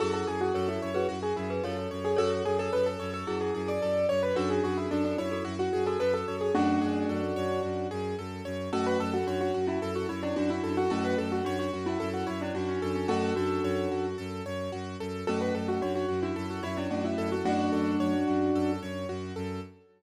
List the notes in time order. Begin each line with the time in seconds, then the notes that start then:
0.00 F#2 E4 F#4 G#4 A4
0.14 A4
0.27 F#2 G#4
0.41 F#4
0.54 F#2 A4 C#5
0.68 E4
0.82 F#2 C#5
0.94 F#4 G#4 B4
1.09 F#2 F#4
1.23 G#4
1.36 F#2 E4 G#4
1.50 G#4 B4
1.63 F#2 F4 A4 C#5
1.91 F#2 C#5
2.05 G#4
2.16 F#2 F#4 A4 C#5
2.45 F#2 G#4
2.59 A4
2.73 F#2 A4 B4
2.86 A4
3.00 F#2 C#5
3.14 A4
3.27 F#2 E4 F#4 G#4
3.41 G#4
3.54 F#2 G#4
3.68 D5
3.82 F#2 A4
4.09 F#2 C#5
4.23 B4
4.36 F#2 D4 F#4 A4
4.50 G#4
4.64 F#2 F#4 G#4
4.77 E4
4.91 F#2 D4 F#4 A4
5.05 D4
5.18 F#2 E4 C#5
5.32 F#4 A4
5.45 F#2 F#4
5.59 F#4
5.73 F#2 G#4
5.86 F#4 A4
5.99 F#2 F#4 A4 B4
6.14 A4
6.27 F#2 C#5
6.41 G#4
6.54 F#2 A3 C#4 D4 F#4
6.81 F#2 G#4
7.09 F#2 A4
7.36 F#2 C#5
7.63 F#2 F#4
7.91 F#2 G#4
8.18 F#2 A4
8.45 F#2 C#5
8.73 F#2 A3 C#4 F#4 A4
8.86 B4
9.00 F#2 A4
9.14 F#4
9.27 F#2 D4 F#4 C#5
9.41 F#4
9.54 F#2 F#4
9.67 C#4 E4
9.82 F#2 A4
9.95 F#4
10.09 F#2 E4 C#5
10.23 C#4 D4 E4
10.36 F#2 D4 F#4
10.50 E4
10.64 F#2 A4
10.77 F#4
10.90 F#2 A3 C#4 F#4 A4
11.05 B4
11.18 F#2 A4
11.32 F#4
11.45 F#2 D4 F#4 C#5
11.59 F#4
11.73 F#2 F#4
11.86 C#4 E4
12.00 F#2 A4
12.14 F#4
12.27 F#2 E4 C#5
12.41 C#4 D4 E4
12.55 F#2 D4 F#4
12.68 C#4
12.82 F#2 A4
12.95 C#4
13.08 F#2 A3 C#4 F#4 A4
13.36 F#2 D4 F#4 A4
13.64 F#2 C#5
13.91 F#2 F#4
14.18 F#2 A4
14.45 F#2 C#5
14.72 F#2 F#4
15.00 F#2 A4
15.27 F#2 A3 C#4 F#4 A4
15.41 B4
15.55 F#2 A4
15.68 F#4
15.82 F#2 D4 F#4 C#5
15.95 F#4
16.09 F#2 F#4
16.23 D4 E4 F#4
16.36 F#2 A4
16.50 F#4
16.63 F#2 E4 C#5
16.77 C#4 D4 E4
16.90 F#2 A3 C#4 D4 F#4
17.05 E4
17.18 F#2 A4
17.32 F#4
17.45 F#2 F#3 A3 D4 F#4
17.72 F#2 A4
18.00 F#2 C#5
18.27 F#2 F#4
18.54 F#2 A4
18.82 F#2 C#5
19.09 F#2 F#4
19.36 F#2 A4